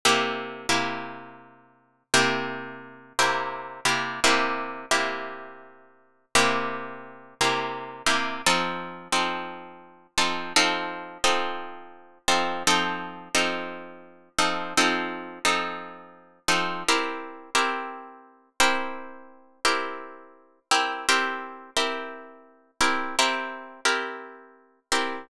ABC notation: X:1
M:4/4
L:1/8
Q:"Swing" 1/4=57
K:C
V:1 name="Acoustic Guitar (steel)"
[C,_B,EG] [C,B,EG]3 [C,B,EG]2 [C,B,EG] [C,B,EG] | [C,_B,EG] [C,B,EG]3 [C,B,EG]2 [C,B,EG] [C,B,EG] | [F,C_EA] [F,CEA]2 [F,CEA] [F,CEA] [F,CEA]2 [F,CEA] | [F,C_EA] [F,CEA]2 [F,CEA] [F,CEA] [F,CEA]2 [F,CEA] |
[CEG_B] [CEGB]2 [CEGB]2 [CEGB]2 [CEGB] | [CEG_B] [CEGB]2 [CEGB] [CEGB] [CEGB]2 [CEGB] |]